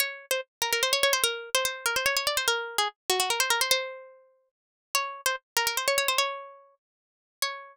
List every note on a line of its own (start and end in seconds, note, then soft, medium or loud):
0.00 0.26 C#5 loud
0.31 0.41 C5 medium
0.62 0.72 A#4 medium
0.73 0.82 A#4 loud
0.83 0.93 C5 loud
0.93 1.03 C#5 loud
1.03 1.13 C#5 loud
1.13 1.23 C5 loud
1.24 1.50 A#4 loud
1.55 1.64 C5 loud
1.65 1.85 C5 loud
1.86 1.96 A#4 loud
1.96 2.06 C5 medium
2.06 2.16 C#5 loud
2.17 2.26 C#5 loud
2.27 2.37 D5 medium
2.37 2.47 C5 loud
2.48 2.77 A#4 loud
2.78 2.88 G#4 medium
3.10 3.19 F#4 loud
3.20 3.29 F#4 loud
3.30 3.40 A#4 medium
3.40 3.50 C5 loud
3.50 3.60 A#4 loud
3.61 3.71 C5 loud
3.71 4.49 C5 loud
4.95 5.21 C#5 loud
5.26 5.36 C5 loud
5.57 5.66 A#4 loud
5.67 5.77 A#4 loud
5.77 5.87 C5 medium
5.88 5.97 C#5 loud
5.98 6.08 C#5 loud
6.08 6.18 C5 loud
6.18 6.75 C#5 loud
7.42 7.77 C#5 loud